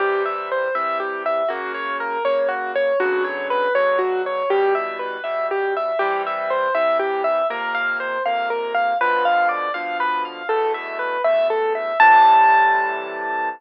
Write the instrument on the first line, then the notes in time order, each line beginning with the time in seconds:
acoustic grand piano
0.00 C3 E3 G3 G4
0.26 E5
0.52 C5
0.75 C3 E3 G3 E5
1.00 G4
1.26 E5
1.49 F#2 C#3 A#3 F#4
1.74 C#5
2.00 A#4
2.25 F#2 C#3 A#3 C#5
2.49 F#4
2.75 C#5
3.00 B2 C#3 D3 F#3 F#4
3.24 C#5
3.50 B4
3.75 B2 C#3 D3 F#3 C#5
3.99 F#4
4.26 C#5
4.50 E2 B2 G3 G4
4.75 E5
4.99 B4
5.24 E2 B2 G3 E5
5.51 G4
5.77 E5
5.99 C3 E3 G3 G4
6.27 E5
6.50 C5
6.75 C3 E3 G3 E5
6.99 G4
7.24 E5
7.50 F2 C3 A#3 A#4
7.75 F5
8.00 C5
8.26 F2 C3 A#3 F5
8.50 A#4
8.74 F5
9.01 B2 D3 F3 B4
9.25 F5
9.49 D5
9.74 B2 D3 F3 F5
10.00 B4
10.25 F5
10.49 E2 B2 A3 A4
10.74 E5
10.99 B4
11.24 E2 B2 A3 E5
11.50 A4
11.75 E5
12.00 A2 C3 E3 G3 A5